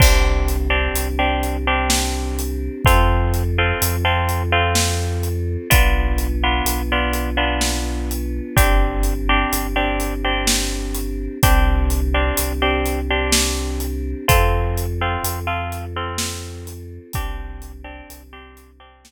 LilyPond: <<
  \new Staff \with { instrumentName = "Orchestral Harp" } { \time 3/4 \key c \major \tempo 4 = 63 <c' d' g'>8. <c' d' g'>8 <c' d' g'>8 <c' d' g'>4~ <c' d' g'>16 | <c' f' a'>8. <c' f' a'>8 <c' f' a'>8 <c' f' a'>4~ <c' f' a'>16 | <b d' f'>8. <b d' f'>8 <b d' f'>8 <b d' f'>4~ <b d' f'>16 | <c' d' g'>8. <c' d' g'>8 <c' d' g'>8 <c' d' g'>4~ <c' d' g'>16 |
<c' d' g'>8. <c' d' g'>8 <c' d' g'>8 <c' d' g'>4~ <c' d' g'>16 | <c' f' a'>8. <c' f' a'>8 <c' f' a'>8 <c' f' a'>4~ <c' f' a'>16 | <c' d' g'>8. <c' d' g'>8 <c' d' g'>8 <c' d' g'>4~ <c' d' g'>16 | }
  \new Staff \with { instrumentName = "Synth Bass 2" } { \clef bass \time 3/4 \key c \major c,4 c,2 | f,4 f,2 | b,,4 b,,2 | g,,4 g,,2 |
c,4 c,2 | f,4 f,2 | c,4 c,2 | }
  \new Staff \with { instrumentName = "Choir Aahs" } { \time 3/4 \key c \major <c' d' g'>2. | <c' f' a'>2. | <b d' f'>2. | <c' d' g'>2. |
<c' d' g'>2. | <c' f' a'>2. | <c' d' g'>2. | }
  \new DrumStaff \with { instrumentName = "Drums" } \drummode { \time 3/4 <cymc bd>8 hh8 hh8 hh8 sn8 hh8 | <hh bd>8 hh8 hh8 hh8 sn8 hh8 | <hh bd>8 hh8 hh8 hh8 sn8 hh8 | <hh bd>8 hh8 hh8 hh8 sn8 hh8 |
<hh bd>8 hh8 hh8 hh8 sn8 hh8 | <hh bd>8 hh8 hh8 hh8 sn8 hh8 | <hh bd>8 hh8 hh8 hh8 sn4 | }
>>